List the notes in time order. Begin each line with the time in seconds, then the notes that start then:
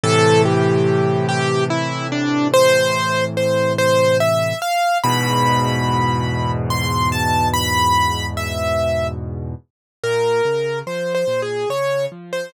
0.03 A2 C3 E3 A4
0.45 G4
1.28 G4
1.70 E4
2.12 D4
2.53 C5
3.37 C5
3.78 C5
4.20 E5
4.62 F5
5.03 E2 G#2 B2 B5
6.70 C6
7.12 A5
7.53 B5
8.37 E5
10.03 A#2 A#4
10.45 C#3
10.87 F3 C5
11.14 C5
11.27 A#2
11.42 G#4
11.69 C#3 C#5
12.12 F3
12.33 C5